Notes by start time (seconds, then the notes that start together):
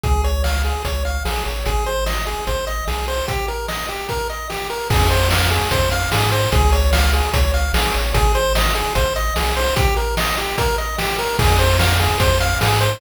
0.03 C#2 G#4, kick, closed hi-hat
0.24 C#5, closed hi-hat
0.44 F5, snare
0.64 G#4, snare, closed hi-hat
0.84 C#2 C#5, kick, closed hi-hat
1.05 F5, closed hi-hat
1.25 A#1 G#4, snare
1.45 A1 C#5, closed hi-hat
1.66 G#1 G#4, kick, closed hi-hat
1.86 C5, closed hi-hat
2.06 D#5, snare
2.27 G#4, snare, closed hi-hat
2.47 G#1 C5, kick, closed hi-hat
2.67 D#5, closed hi-hat
2.87 B1 G#4, snare
3.08 C5, open hi-hat
3.28 G4, kick, closed hi-hat
3.48 A#4, closed hi-hat
3.68 D#5, snare
3.88 G4, snare, closed hi-hat
4.09 A#4, kick, closed hi-hat
4.29 D#5, closed hi-hat
4.50 G4, snare
4.70 A#4, closed hi-hat
4.90 F2 G#4, kick, crash
5.10 C5, closed hi-hat
5.31 F5, snare
5.51 G#4, snare, closed hi-hat
5.71 F2 C5, kick, closed hi-hat
5.91 F5, closed hi-hat
6.12 G#2 G#4, snare
6.32 C5, closed hi-hat
6.52 C#2 G#4, kick, closed hi-hat
6.72 C#5, closed hi-hat
6.93 F5, snare
7.13 G#4, snare, closed hi-hat
7.33 C#2 C#5, kick, closed hi-hat
7.54 F5, closed hi-hat
7.73 A#1 G#4, snare
7.94 A1 C#5, closed hi-hat
8.14 G#1 G#4, kick, closed hi-hat
8.35 C5, closed hi-hat
8.55 D#5, snare
8.75 G#4, snare, closed hi-hat
8.95 G#1 C5, kick, closed hi-hat
9.16 D#5, closed hi-hat
9.36 B1 G#4, snare
9.56 C5, open hi-hat
9.76 G4, kick, closed hi-hat
9.96 A#4, closed hi-hat
10.17 D#5, snare
10.37 G4, snare, closed hi-hat
10.58 A#4, kick, closed hi-hat
10.78 D#5, closed hi-hat
10.98 G4, snare
11.18 A#4, closed hi-hat
11.39 F2 G#4, kick, crash
11.59 C5, closed hi-hat
11.79 F5, snare
12.00 G#4, snare, closed hi-hat
12.20 F2 C5, kick, closed hi-hat
12.40 F5, closed hi-hat
12.61 G#2 G#4, snare
12.81 C5, closed hi-hat